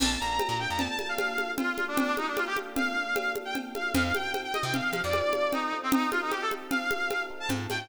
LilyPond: <<
  \new Staff \with { instrumentName = "Brass Section" } { \time 5/4 \key bes \major \tempo 4 = 152 a''8 bes''8. bes''16 g''16 bes''16 a''16 a''8 f''4~ f''16 f'8. d'16 | d'8 ees'16 d'16 f'16 g'16 r8 f''4. r16 g''16 r8 f''8 | f''8 g''8. g''16 ees''16 g''16 f''16 f''8 d''4~ d''16 ees'8. c'16 | ees'8 f'16 ees'16 g'16 a'16 r8 f''4. r16 a''16 r8 g''8 | }
  \new Staff \with { instrumentName = "Electric Piano 1" } { \time 5/4 \key bes \major <bes d' f' a'>8 <bes d' f' a'>4 <bes d' f' a'>8 <bes d' f' a'>8 <bes d' f' a'>8 <bes d' f' a'>8 <bes d' f' a'>4 <bes d' f' a'>8~ | <bes d' f' a'>8 <bes d' f' a'>4 <bes d' f' a'>8 <bes d' f' a'>8 <bes d' f' a'>8 <bes d' f' a'>8 <bes d' f' a'>4 <bes d' f' a'>8 | <c' ees' f' a'>8 <c' ees' f' a'>4 <c' ees' f' a'>8 <c' ees' f' a'>8 <c' ees' f' a'>8 <c' ees' f' a'>8 <c' ees' f' a'>4 <c' ees' f' a'>8~ | <c' ees' f' a'>8 <c' ees' f' a'>4 <c' ees' f' a'>8 <c' ees' f' a'>8 <c' ees' f' a'>8 <c' ees' f' a'>8 <c' ees' f' a'>4 <c' ees' f' a'>8 | }
  \new Staff \with { instrumentName = "Electric Bass (finger)" } { \clef bass \time 5/4 \key bes \major bes,,8 bes,,8. bes,8 f,2.~ f,16~ | f,1~ f,4 | f,4.~ f,16 c8. f16 f,2~ f,16~ | f,1 aes,8 a,8 | }
  \new DrumStaff \with { instrumentName = "Drums" } \drummode { \time 5/4 <cgl cb cymc>4 <cgho cb>4 <cgl cb>8 cgho8 <cgho cb>8 cgho8 <cgl cb>8 cgho8 | <cgl cb>8 cgho8 <cgho cb>8 cgho8 <cgl cb>4 <cgho cb>8 cgho8 <cgl cb>8 cgho8 | <cgl cb>8 cgho8 <cgho cb>8 cgho8 <cgl cb>8 cgho8 <cgho cb>8 cgho8 <cgl cb>4 | <cgl cb>8 cgho8 <cgho cb>8 cgho8 <cgl cb>8 cgho8 <cgho cb>4 <cgl cb>8 cgho8 | }
>>